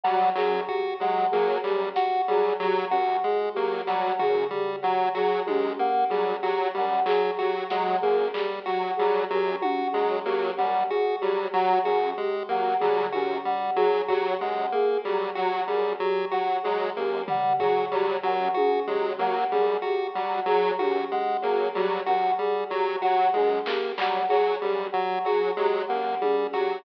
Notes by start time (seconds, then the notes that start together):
0.03 F#3 G3 F#5, cowbell
0.35 F#2 F#3 G#4, clap
0.68 F#4 G4, kick
1.00 F#3 G#3 F#5
1.31 F#3 A#3 G#4
1.63 F#2 G3 G4, clap
1.95 F#4 F#5, snare
2.28 F#3 G3 G#4
2.60 F#3 G4
2.90 F#2 F#4 F#5
3.24 G#3 G#4
3.54 F#3 A#3 G4
3.87 F#3 G3 F#5, snare
4.19 F#2 F#4 G#4, floor tom
4.51 G3 G4, floor tom
4.82 F#3 F#5
5.14 F#3 F#4 G#4
5.46 F#2 G#3 G4, high tom
5.79 A#3 F#5
6.10 F#3 G3 G#4
6.43 F#3 F#4 G4
6.74 F#2 G3 F#5
7.06 F#3 G#4, clap
7.37 F#3 F#4 G4
7.69 F#3 G#3 F#5, snare
8.01 F#2 A#3 G#4, kick
8.34 G3 G4, clap
8.66 F#3 F#4 F#5
8.97 F#3 G3 G#4
9.30 F#2 F#3 G4
9.62 F#4 F#5, high tom
9.93 F#3 G#3 G#4, cowbell
10.25 F#3 A#3 G4
10.58 F#2 G3 F#5
10.89 F#4 G#4
11.20 F#3 G3 G4
11.53 F#3 F#5
11.84 F#2 F#4 G#4
12.17 G#3 G4
12.49 F#3 A#3 F#5, kick
12.80 F#3 G3 G#4, floor tom
13.12 F#2 F#4 G4, high tom
13.45 G3 F#5
13.76 F#3 G#4
14.08 F#3 F#4 G4, kick
14.40 F#2 G#3 F#5
14.72 A#3 G#4
15.04 F#3 G3 G4
15.35 F#3 F#4 F#5
15.67 F#2 G3 G#4
16.00 F#3 G4
16.31 F#3 F#4 F#5
16.63 F#3 G#3 G#4
16.96 F#2 A#3 G4
17.28 G3 F#5, floor tom
17.59 F#3 F#4 G#4, kick
17.91 F#3 G3 G4
18.23 F#2 F#3 F#5
18.54 F#4 G#4, high tom
18.87 F#3 G#3 G4, floor tom
19.18 F#3 A#3 F#5
19.52 F#2 G3 G#4
19.82 F#4 G4, cowbell
20.14 F#3 G3 F#5
20.46 F#3 G#4
20.78 F#2 F#4 G4, high tom
21.11 G#3 F#5
21.42 F#3 A#3 G#4
21.75 F#3 G3 G4, cowbell
22.06 F#2 F#4 F#5, closed hi-hat
22.39 G3 G#4
22.70 F#3 G4
23.02 F#3 F#4 F#5
23.34 F#2 G#3 G#4, high tom
23.66 A#3 G4, clap
23.98 F#3 G3 F#5, clap
24.29 F#3 F#4 G#4
24.62 F#2 G3 G4
24.92 F#3 F#5, kick
25.25 F#3 F#4 G#4
25.56 F#3 G#3 G4
25.88 F#2 A#3 F#5
26.21 G3 G#4, high tom
26.53 F#3 F#4 G4, closed hi-hat